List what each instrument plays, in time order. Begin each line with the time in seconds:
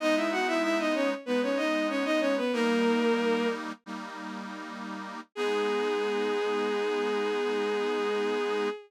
0.00 accordion G#3 B3 D#4, violin D#4 D#5
0.16 violin E4 E5
0.32 violin F#4 F#5
0.47 violin E4 E5
0.63 violin E4 E5
0.79 violin D#4 D#5
0.95 violin C#4 C#5
1.26 accordion G#3 B3 D#4, violin B3 B4
1.43 violin C#4 C#5
1.57 violin D#4 D#5
1.89 violin C#4 C#5
2.05 violin D#4 D#5
2.20 violin C#4 C#5
2.37 violin B3 B4
2.53 accordion G3 A#3 D#4, violin A#3 A#4
3.86 accordion G3 A#3 D#4
5.35 accordion G#3 B3 D#4, violin G#4